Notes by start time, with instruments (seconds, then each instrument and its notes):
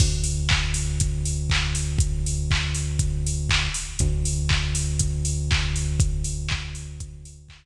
0.00 synth bass 1 D2, kick, crash
0.24 open hi-hat
0.49 kick, clap
0.74 open hi-hat
1.00 kick, closed hi-hat
1.25 open hi-hat
1.50 kick, clap
1.75 open hi-hat
1.99 kick, closed hi-hat
2.26 open hi-hat
2.51 kick, clap
2.74 open hi-hat
2.99 kick, closed hi-hat
3.26 open hi-hat
3.49 kick, clap
3.74 open hi-hat
3.99 synth bass 1 D2, kick, closed hi-hat
4.25 open hi-hat
4.49 kick, clap
4.75 open hi-hat
4.99 kick, closed hi-hat
5.25 open hi-hat
5.51 kick, clap
5.76 open hi-hat
6.00 kick, closed hi-hat
6.24 open hi-hat
6.49 kick, clap
6.75 open hi-hat
7.00 kick, closed hi-hat
7.25 open hi-hat
7.49 kick, clap